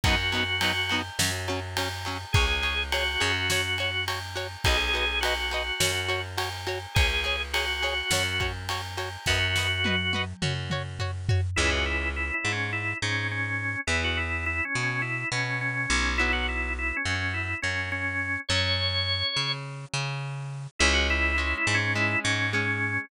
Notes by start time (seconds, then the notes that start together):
0.04 F#2 F#3 B3 D#4 F#4, kick, ride
0.32 F#3 B3 D#4, ride
0.61 F#3 B3 D#4, ride
0.89 F#3 B3 D#4, ride
1.19 F#2 F#3 C#4, snare
1.48 F#3 C#4, ride
1.77 F#3 C#4, ride
2.05 F#3 C#4, ride
2.33 C#2 G#4 C#5, kick, ride
2.62 G#4 C#5, ride
2.92 F#4 G#4 C#5, ride
3.20 F#2 G#4 C#5, ride
3.50 F#4 C#5, snare
3.78 F#4 C#5, ride
4.08 F#4 C#5, ride
4.36 F#4 C#5, ride
4.64 B1 F#4 G#4 B4 D#5, kick, ride
4.94 F#4 B4 D#5, ride
5.21 F#4 B4, ride
5.25 D#5
5.51 F#4 B4 D#5, ride
5.80 F#2 F#4 C#5, snare
6.08 F#4 C#5, ride
6.37 F#4 C#5, ride
6.67 F#4 C#5, ride
6.95 C#2 G#4 C#5, kick, ride
7.24 G#4 C#5, ride
7.53 F#4 G#4 C#5, ride
7.82 G#4 C#5, ride
8.11 F#2 F#4 C#5, snare
8.40 F#4 C#5, kick, ride
8.69 F#4 C#5, ride
8.97 F#4 C#5, ride
9.26 F#2 F#4 B4 D#5, kick, snare
9.56 F#4 B4 D#5, snare
9.84 F#4 B4 D#5, high tom
10.13 F#4 B4 D#5, high tom
10.42 F#2 F#4 C#5, mid tom
10.70 F#4 C#5, mid tom
10.99 F#4 C#5, floor tom
11.29 F#4 C#5, floor tom
11.56 C#2 E3 G#3 C#4 E4
11.71 F#4
11.86 E4
12.16 E4
12.34 E4
12.45 G#2
12.52 C#4
12.73 E4
13.02 G#2 C#4
13.31 C#4
13.87 E2 E3 B3 E4
14.04 F#4
14.17 E4
14.46 E4
14.65 C#4
14.75 B2
14.83 C#4
15.02 E4
15.32 B2 C#4
15.61 C#4
15.90 B1
16.18 F#3 B3 E4
16.33 F#4
16.49 E4
16.79 E4
16.97 C#4
17.05 F#2
17.15 C#4
17.34 E4
17.62 F#2 C#4
17.92 C#4
18.49 F#2 F#3 C#4 C#5
19.36 C#3
19.94 C#3
20.79 C#2 G#3 C#4 E4
20.93 F#4
21.10 E4
21.37 G#3 C#4 E4
21.57 E4
21.67 G#2
21.75 C#4
21.95 G#3 C#4 E4
22.24 G#2 C#4
22.53 G#3 C#4